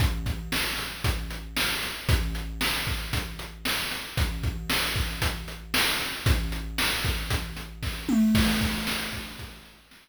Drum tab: CC |--------|--------|--------|--------|
HH |xx-xxx-x|xx-xxx-x|xx-xxx-x|xx-xxx--|
SD |--o---o-|--o---o-|--o---o-|--o---o-|
T2 |--------|--------|--------|-------o|
BD |oo--o---|o--oo---|oo-oo---|o--oo-o-|

CC |x-------|
HH |-x-xxx--|
SD |--o---o-|
T2 |--------|
BD |oo-oo---|